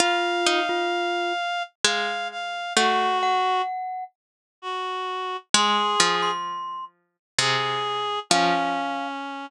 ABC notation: X:1
M:3/4
L:1/16
Q:1/4=65
K:Dblyd
V:1 name="Glockenspiel"
F3 F3 z6 | _g2 g4 z6 | c'3 c'3 z6 | f4 z8 |]
V:2 name="Clarinet"
f8 f2 f2 | _G4 z4 G4 | A4 z4 A4 | D6 z6 |]
V:3 name="Harpsichord"
F2 E6 A,4 | =A,4 z8 | A,2 F,6 C,4 | F,4 z8 |]